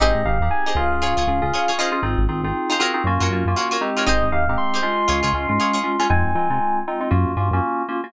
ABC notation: X:1
M:4/4
L:1/16
Q:"Swing 16ths" 1/4=118
K:Abmix
V:1 name="Electric Piano 1"
e2 f2 a2 f10 | z16 | e2 f2 c'2 c'10 | a6 z10 |]
V:2 name="Acoustic Guitar (steel)"
[E=GAc]5 [EGAc]3 [FAd] [FAd]3 [FAd] [FAd] [EFAc]2- | [EFAc]5 [EFAc] [FGBd]3 [FGBd]3 [FGBd] [FGBd]2 [FGBd] | [E=GAc]5 [EGAc]3 [FAd] [FAd]3 [FAd] [FAd]2 [FAd] | z16 |]
V:3 name="Electric Piano 2"
[CE=GA]2 [CEGA] [CEGA]3 [DFA]4 [DFA] [DFA]3 [DFA] [DFA] | [CEFA]2 [CEFA] [CEFA]3 [CEFA] [CEFA] [B,DFG]2 [B,DFG] [B,DFG]3 [A,CE=G]2- | [A,CE=G]2 [A,CEG] [A,CEG]3 [A,DF]4 [A,DF] [A,DF]3 [A,DF] [A,DF] | [A,CEF]2 [A,CEF] [A,CEF]3 [A,CEF] [A,CEF] [B,DFG]2 [B,DFG] [B,DFG]3 [B,DFG] [B,DFG] |]
V:4 name="Synth Bass 1" clef=bass
A,,, A,, A,,, E,,3 D,,3 D,, D,, D,,5 | A,,, A,,, A,,, A,,,5 G,, G,, G,, G,,5 | A,,, A,,, E,, A,,,5 D,, D,, D,, A,,5 | F,, F,, F, C,5 G,, G,, =G,, _G,,5 |]